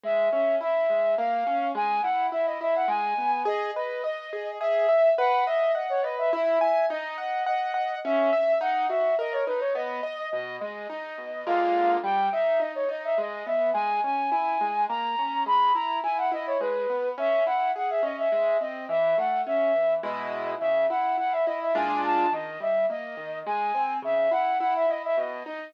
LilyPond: <<
  \new Staff \with { instrumentName = "Flute" } { \time 3/4 \key gis \minor \tempo 4 = 105 e''8 e''8 e''4 eis''4 | gis''8 fis''8 e''16 dis''16 e''16 fis''16 gis''4 | dis''8 dis''8 dis''4 e''4 | fis''8 e''8 dis''16 cis''16 dis''16 e''16 e''8 e''8 |
dis''8 dis''8 dis''4 e''4 | fis''8 e''8 dis''16 cis''16 b'16 cis''16 dis''4 | dis''8 dis''8 dis''4 eis''4 | g''8 e''8 dis''16 cis''16 dis''16 e''16 dis''8 e''8 |
gis''8 gis''8 gis''4 ais''4 | b''8 ais''8 gis''16 fis''16 dis''16 cis''16 b'4 | \key cis \minor e''8 fis''8 fis''16 e''16 dis''16 e''16 e''8 dis''8 | e''8 fis''8 e''4 dis''4 |
e''8 fis''8 fis''16 e''16 dis''16 e''16 gis''8 a''8 | dis''8 e''8 dis''4 gis''4 | e''8 fis''8 fis''16 e''16 dis''16 e''16 dis''8 dis''8 | }
  \new Staff \with { instrumentName = "Acoustic Grand Piano" } { \time 3/4 \key gis \minor gis8 cis'8 e'8 gis8 ais8 cis'8 | gis8 e'8 e'8 e'8 gis8 b8 | gis'8 b'8 dis''8 gis'8 gis'8 e''8 | b'8 dis''8 fis''8 b'8 e'8 gis''8 |
dis'8 fis''8 fis''8 fis''8 cis'8 e''8 | dis'8 fis'8 ais'8 dis'8 b8 dis''8 | b,8 gis8 dis'8 b,8 <d gis ais eis'>4 | g8 dis'8 dis'8 dis'8 gis8 b8 |
gis8 cis'8 e'8 gis8 ais8 cis'8 | gis8 e'8 e'8 e'8 gis8 b8 | \key cis \minor cis'8 e'8 gis'8 cis'8 gis8 bis8 | e8 a8 cis'8 e8 <b, gis e'>4 |
cis8 e'8 e'8 e'8 <ais, gis d' eis'>4 | dis8 g8 ais8 dis8 gis8 bis8 | cis8 e'8 e'8 e'8 b,8 dis'8 | }
>>